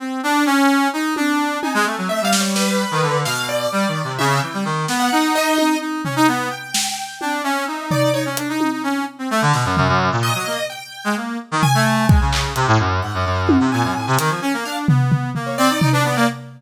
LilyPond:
<<
  \new Staff \with { instrumentName = "Brass Section" } { \time 7/8 \tempo 4 = 129 c'8 d'8 cis'4 dis'8 d'4 | dis'16 gis16 a16 fis16 a16 g4. dis16 d8 | b,4 \tuplet 3/2 { g8 dis8 c8 } cis8 e16 g16 dis8 | b8 dis'4. dis'8 cis'16 dis'16 b8 |
r4. d'8 cis'8 dis'4 | dis'16 cis'16 d'16 dis'8 dis'16 cis'8 r16 c'16 a16 d16 b,16 fis,16 | fis,16 fis,8 ais,8 fis16 ais16 r4 gis16 ais8 | r16 dis16 r16 a8. gis16 cis8. c16 a,16 fis,8 |
gis,16 fis,16 fis,8. c16 ais,16 fis,16 a,16 c16 dis16 f16 cis'16 ais16 | d'8 b4 ais8 c'16 dis'16 dis'16 d'16 b16 ais16 | }
  \new Staff \with { instrumentName = "Acoustic Grand Piano" } { \time 7/8 r2. r8 | gis''8. gis''16 \tuplet 3/2 { e''8 f''8 cis''8 } b'4. | f''8 d''4. e''8 g''4 | r16 fis''8. dis''4 r4. |
g''2 e''4 d''8 | cis''16 r2. r16 | r4 dis''4 g''4 r8 | r8 gis''8 gis''4 r4. |
fis''4. gis''2 | f''16 r4. cis''16 d''8. b'16 d''8 | }
  \new DrumStaff \with { instrumentName = "Drums" } \drummode { \time 7/8 r4 r4 r8 tommh4 | tommh4 r8 sn8 sn4. | sn4 r4 tommh4. | sn4 r8 tommh8 r8 tomfh4 |
r8 sn8 r8 tommh8 r4 tomfh8 | r8 hh8 tommh4 r4 sn8 | tomfh4 r4 r4. | r8 tomfh8 r8 bd8 hc8 hh4 |
r4 tommh4 r8 hh4 | r8 tomfh8 tomfh8 tomfh8 r8 tomfh4 | }
>>